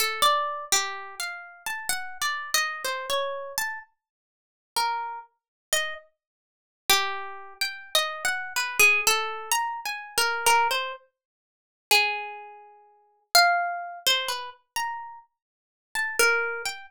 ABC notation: X:1
M:3/4
L:1/16
Q:1/4=63
K:none
V:1 name="Pizzicato Strings"
A d2 G2 f2 a (3^f2 d2 ^d2 | c ^c2 a z4 ^A2 z2 | ^d z4 G3 (3g2 d2 ^f2 | B ^G A2 (3^a2 ^g2 ^A2 A c z2 |
z2 ^G6 f3 c | B z ^a2 z3 =a ^A2 g z |]